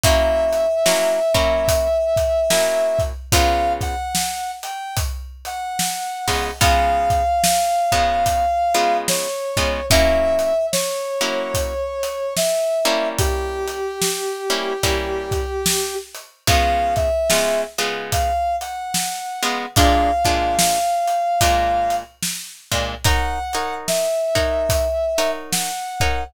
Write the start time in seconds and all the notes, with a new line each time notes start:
0.03 F#3 A#3 C#4 E4 E5, kick, closed hi-hat
0.53 closed hi-hat
0.86 F#3 A#3 C#4 E4, snare
1.34 F#3 A#3 C#4 E4, kick, closed hi-hat
1.68 kick, closed hi-hat
2.16 kick, closed hi-hat
2.50 F#3 A#3 C#4 E4, snare
2.99 kick, closed hi-hat
3.32 C#3 G#3 B3 F4 F5, kick, closed hi-hat
3.81 F#5, kick, closed hi-hat
4.15 snare
4.63 G5, closed hi-hat
4.97 kick, closed hi-hat
5.45 F#5, closed hi-hat
5.79 snare
6.28 C#3 G#3 B3 F4, kick, open hi-hat
6.61 C#3 G#3 B3 F4 F5, kick, closed hi-hat
7.10 kick, closed hi-hat
7.43 snare
7.92 C#3 G#3 B3 F4, kick, closed hi-hat
8.26 kick, closed hi-hat
8.74 C#3 G#3 B3 F4, closed hi-hat
9.08 C#5, snare
9.57 C#3 G#3 B3 F4, kick, closed hi-hat
9.90 F#3 A#3 C#4 E4 E5, kick, closed hi-hat
10.39 closed hi-hat
10.72 C#5, snare
11.21 F#3 A#3 C#4 E4, closed hi-hat
11.54 kick, closed hi-hat
12.03 closed hi-hat
12.36 E5, snare
12.85 G3 A#3 C#4 E4, closed hi-hat
13.18 G4, kick, closed hi-hat
13.67 closed hi-hat
14.02 snare
14.50 G3 A#3 C#4 E4, closed hi-hat
14.83 G3 A#3 C#4 E4, kick, closed hi-hat
15.31 kick, closed hi-hat
15.66 snare
16.15 closed hi-hat
16.47 C#3 G#3 B3 F4 F5, kick, closed hi-hat
16.96 E5, kick, closed hi-hat
17.30 C#3 G#3 B3 F4, snare
17.78 C#3 G#3 B3 F4, closed hi-hat
18.12 F5, kick, closed hi-hat
18.61 F#5, closed hi-hat
18.94 snare
19.42 C#3 G#3 B3 F4, closed hi-hat
19.76 A#2 G#3 D4 F4 F5, kick, closed hi-hat
20.24 A#2 G#3 D4 F4, kick, closed hi-hat
20.59 snare
21.07 closed hi-hat
21.41 A#2 G#3 D4 F4, kick, closed hi-hat
21.90 closed hi-hat
22.22 snare
22.71 A#2 G#3 D4 F4, kick, closed hi-hat
23.04 D#4 A#4 C#5 F#5, kick, closed hi-hat
23.53 D#4 A#4 C#5 F#5, closed hi-hat
23.88 E5, snare
24.35 D#4 A#4 C#5 F#5, kick, closed hi-hat
24.69 kick, closed hi-hat
25.18 D#4 A#4 C#5 F#5, closed hi-hat
25.52 F#5, snare
26.00 D#4 A#4 C#5 F#5, kick, closed hi-hat